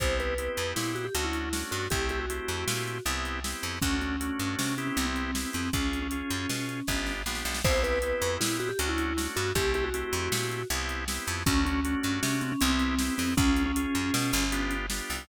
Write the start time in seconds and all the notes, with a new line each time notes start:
0.00 C2 B3 C4 E4 G4 C5, kick, closed hi-hat
0.20 B4, closed hi-hat
0.38 B3 C4 E4 G4, closed hi-hat
0.57 F2, closed hi-hat
0.76 A#2 E4, snare
0.95 F#4, closed hi-hat
1.05 G4
1.15 D2 A3 C#4 D4 F#4, closed hi-hat
1.25 E4
1.33 closed hi-hat
1.53 A3 C#4 D4 F#4, snare
1.71 G2 F#4, closed hi-hat
1.90 C2 A3 C4 E4 G4, kick, closed hi-hat
2.09 G4, closed hi-hat
2.20 F#4
2.30 A3 C4 E4 G4, closed hi-hat
2.48 F2, closed hi-hat
2.68 A#2, snare
2.88 closed hi-hat
3.05 C2 B3 C4 E4 G4, closed hi-hat
3.25 closed hi-hat
3.44 B3 C4 E4 G4, snare
3.63 F2, closed hi-hat
3.82 D2 A3 C#4 D4 F#4, kick, closed hi-hat
4.01 C#4, closed hi-hat
4.20 A3 C#4 D4 F#4, closed hi-hat
4.39 G2, closed hi-hat
4.59 C3 C#4, snare
4.78 B3 C4 C#4 E4 G4, closed hi-hat
4.87 C#4
4.97 C2 C4, closed hi-hat
5.06 C4
5.16 closed hi-hat
5.35 B3 C4 E4 G4, snare
5.53 F2 C4, closed hi-hat
5.73 C#2 C#4 F4 G#4, kick, closed hi-hat
5.93 closed hi-hat
6.02 C#4
6.11 C#4 F4 G#4, closed hi-hat
6.30 F#2, closed hi-hat
6.49 B2, snare
6.69 closed hi-hat
6.87 G1 B3 D4 F4 G4, kick, snare
7.06 snare
7.26 A#1 B3 D4 F4 G4, snare
7.35 snare
7.45 B1, snare
7.54 snare
7.64 C2 B3 C4 E4 G4 C5, kick, crash
7.84 B4, closed hi-hat
8.02 B3 C4 E4 G4, closed hi-hat
8.22 F2, closed hi-hat
8.41 A#2 E4, snare
8.60 F#4, closed hi-hat
8.69 G4
8.79 D2 A3 C#4 D4 F#4, closed hi-hat
8.89 E4
8.98 closed hi-hat
9.17 A3 C#4 D4 F#4, snare
9.36 G2 F#4, closed hi-hat
9.55 C2 A3 C4 E4 G4, kick, closed hi-hat
9.74 G4, closed hi-hat
9.84 F#4
9.94 A3 C4 E4 G4, closed hi-hat
10.13 F2, closed hi-hat
10.32 A#2, snare
10.52 closed hi-hat
10.70 C2 B3 C4 E4 G4, closed hi-hat
10.89 closed hi-hat
11.08 B3 C4 E4 G4, snare
11.27 F2, closed hi-hat
11.46 D2 A3 C#4 D4 F#4, kick, closed hi-hat
11.66 C#4, closed hi-hat
11.85 A3 C#4 D4 F#4, closed hi-hat
12.03 G2, closed hi-hat
12.23 C3 C#4, snare
12.41 C4, closed hi-hat
12.52 C#4
12.61 C2 B3 C4 E4 G4, closed hi-hat
12.70 C4
12.79 closed hi-hat
12.99 B3 C4 E4 G4, snare
13.18 F2 C4, open hi-hat
13.37 C#2 C#4 F4 G#4, kick, closed hi-hat
13.56 closed hi-hat
13.66 C#4
13.76 C#4 F4 G#4, closed hi-hat
13.95 F#2, closed hi-hat
14.14 B2, snare
14.33 G1, closed hi-hat
14.52 B3 D4 F4 G4, closed hi-hat
14.71 closed hi-hat
14.90 B3 D4 F4 G4, snare
15.10 C2, open hi-hat